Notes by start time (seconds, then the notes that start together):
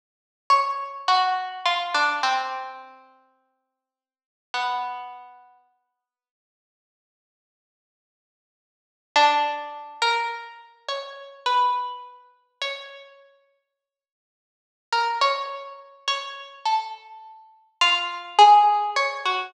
0.50 C#5
1.08 F#4
1.66 F4
1.94 D4
2.23 C4
4.54 B3
9.16 D4
10.02 A#4
10.89 C#5
11.46 B4
12.62 C#5
14.93 A#4
15.21 C#5
16.08 C#5
16.66 A4
17.81 F4
18.39 G#4
18.96 C#5
19.25 F#4